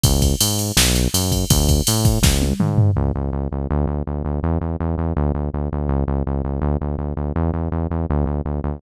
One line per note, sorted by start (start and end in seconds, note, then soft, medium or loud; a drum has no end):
0.04 0.35 C#2 loud
0.04 kick loud
0.04 ride loud
0.22 kick medium
0.22 ride medium
0.40 0.72 G#2 medium
0.40 ride loud
0.59 ride medium
0.77 1.08 B1 loud
0.77 snare loud
0.95 ride medium
1.14 1.45 F#2 medium
1.14 ride loud
1.32 kick medium
1.32 ride medium
1.50 1.81 D2 loud
1.50 kick loud
1.50 ride loud
1.69 kick medium
1.69 ride medium
1.87 2.19 A2 medium
1.87 ride loud
2.05 kick loud
2.05 ride medium
2.22 2.53 C#2 loud
2.22 kick loud
2.22 snare loud
2.42 high tom medium
2.60 2.91 G#2 medium
2.60 mid tom medium
2.78 floor tom loud
2.96 3.12 C#2 loud
3.15 3.31 C#2 medium
3.33 3.48 C#2 medium
3.52 3.67 C#2 medium
3.71 3.86 D2 loud
3.87 4.03 D2 medium
4.07 4.23 D2 medium
4.25 4.40 D2 medium
4.43 4.58 E2 loud
4.61 4.76 E2 medium
4.80 4.96 E2 medium
4.98 5.13 E2 medium
5.16 5.32 D2 loud
5.34 5.50 D2 medium
5.54 5.69 D2 medium
5.72 5.88 D2 medium
5.89 6.04 C#2 loud
6.08 6.23 C#2 medium
6.27 6.42 C#2 medium
6.44 6.60 C#2 medium
6.62 6.77 D2 loud
6.81 6.96 D2 medium
6.98 7.14 D2 medium
7.17 7.32 D2 medium
7.36 7.51 E2 loud
7.54 7.69 E2 medium
7.72 7.87 E2 medium
7.90 8.06 E2 medium
8.10 8.25 D2 loud
8.26 8.41 D2 medium
8.45 8.61 D2 medium
8.64 8.79 D2 medium